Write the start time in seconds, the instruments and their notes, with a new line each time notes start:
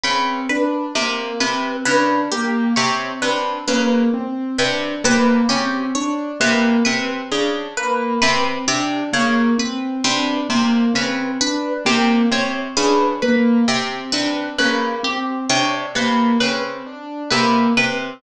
0.04 pizzicato strings C#3, acoustic grand piano C4, orchestral harp B4
0.49 acoustic grand piano D4, orchestral harp B4
0.95 pizzicato strings C3, acoustic grand piano A#3
1.40 pizzicato strings C3, acoustic grand piano C4, orchestral harp B4
1.85 pizzicato strings C#3, acoustic grand piano D4, orchestral harp B4
2.32 acoustic grand piano A#3, orchestral harp G4
2.76 pizzicato strings C3, acoustic grand piano C4, orchestral harp C#5
3.22 pizzicato strings C3, acoustic grand piano D4, orchestral harp B4
3.68 pizzicato strings C#3, acoustic grand piano A#3, orchestral harp B4
4.14 acoustic grand piano C4
4.59 pizzicato strings C3, acoustic grand piano D4, orchestral harp B4
5.04 pizzicato strings C3, acoustic grand piano A#3, orchestral harp B4
5.49 pizzicato strings C#3, acoustic grand piano C4, orchestral harp G4
5.95 acoustic grand piano D4, orchestral harp C#5
6.40 pizzicato strings C3, acoustic grand piano A#3, orchestral harp B4
6.85 pizzicato strings C3, acoustic grand piano C4, orchestral harp B4
7.32 pizzicato strings C#3, acoustic grand piano D4
7.77 acoustic grand piano A#3, orchestral harp B4
8.22 pizzicato strings C3, acoustic grand piano C4, orchestral harp B4
8.67 pizzicato strings C3, acoustic grand piano D4, orchestral harp G4
9.13 pizzicato strings C#3, acoustic grand piano A#3, orchestral harp C#5
9.58 acoustic grand piano C4, orchestral harp B4
10.04 pizzicato strings C3, acoustic grand piano D4, orchestral harp B4
10.50 pizzicato strings C3, acoustic grand piano A#3
10.94 pizzicato strings C#3, acoustic grand piano C4, orchestral harp B4
11.41 acoustic grand piano D4, orchestral harp B4
11.85 pizzicato strings C3, acoustic grand piano A#3, orchestral harp G4
12.31 pizzicato strings C3, acoustic grand piano C4, orchestral harp C#5
12.77 pizzicato strings C#3, acoustic grand piano D4, orchestral harp B4
13.22 acoustic grand piano A#3, orchestral harp B4
13.68 pizzicato strings C3, acoustic grand piano C4
14.12 pizzicato strings C3, acoustic grand piano D4, orchestral harp B4
14.59 pizzicato strings C#3, acoustic grand piano A#3, orchestral harp B4
15.03 acoustic grand piano C4, orchestral harp G4
15.50 pizzicato strings C3, acoustic grand piano D4, orchestral harp C#5
15.95 pizzicato strings C3, acoustic grand piano A#3, orchestral harp B4
16.40 pizzicato strings C#3, acoustic grand piano C4, orchestral harp B4
16.86 acoustic grand piano D4
17.30 pizzicato strings C3, acoustic grand piano A#3, orchestral harp B4
17.77 pizzicato strings C3, acoustic grand piano C4, orchestral harp B4